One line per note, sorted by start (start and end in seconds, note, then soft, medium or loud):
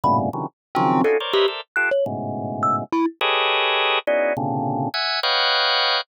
0.04 0.30 G2 medium
0.04 0.30 A2 medium
0.04 0.30 A#2 medium
0.04 0.30 B2 medium
0.04 0.30 C#3 medium
0.04 0.17 B5 medium
0.33 0.46 C3 medium
0.33 0.46 C#3 medium
0.33 0.46 D3 medium
0.33 0.46 D#3 medium
0.33 0.46 E3 medium
0.33 0.46 F#3 medium
0.75 1.02 C#3 loud
0.75 1.02 D#3 loud
0.75 1.02 F3 loud
0.75 1.02 F#3 loud
0.75 1.01 C4 loud
1.04 1.17 C#4 medium
1.04 1.17 D4 medium
1.04 1.17 D#4 medium
1.04 1.17 F4 medium
1.04 1.17 F#4 medium
1.04 1.17 G#4 medium
1.04 1.17 A4 medium
1.20 1.33 A#4 medium
1.20 1.33 C5 medium
1.20 1.33 C#5 medium
1.20 1.33 D5 medium
1.33 1.47 G4 medium
1.33 1.46 A#4 medium
1.33 1.46 B4 medium
1.33 1.46 C5 medium
1.33 1.46 C#5 medium
1.33 1.46 D#5 medium
1.33 1.46 E5 medium
1.48 1.61 A4 soft
1.48 1.61 A#4 soft
1.48 1.61 C5 soft
1.48 1.61 D5 soft
1.48 1.61 E5 soft
1.76 1.90 F4 medium
1.76 1.90 G4 medium
1.76 1.90 A4 medium
1.76 1.89 F#6 medium
1.91 2.04 C#5 medium
2.06 2.84 G#2 medium
2.06 2.84 A2 medium
2.06 2.84 B2 medium
2.06 2.84 C#3 medium
2.63 2.76 E6 medium
2.92 3.05 E4 medium
3.21 3.99 G4 loud
3.21 3.99 G#4 loud
3.21 3.99 A4 loud
3.21 3.99 B4 loud
3.21 3.99 C#5 loud
3.21 3.99 D#5 loud
4.07 4.33 B3 medium
4.07 4.33 C#4 medium
4.07 4.33 D#4 medium
4.07 4.33 E4 medium
4.07 4.33 F#4 medium
4.07 4.33 G#4 medium
4.07 4.33 D5 medium
4.37 4.89 A#2 medium
4.37 4.89 C3 medium
4.37 4.89 C#3 medium
4.37 4.89 D3 medium
4.94 5.20 E5 loud
4.94 5.20 F#5 loud
4.94 5.20 G#5 loud
5.23 6.01 B4 loud
5.23 6.01 C#5 loud
5.23 6.01 D#5 loud
5.23 6.01 F5 loud
5.23 6.01 F#5 loud
5.23 6.01 G5 loud